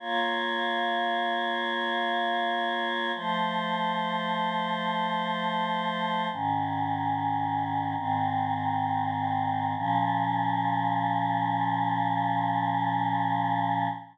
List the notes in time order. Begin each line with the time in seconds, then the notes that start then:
0.00 A#3 F4 C#5
3.15 F3 A3 C5
6.32 G#2 D#3 C#4
7.97 G#2 D#3 C4
9.77 A#2 F3 C#4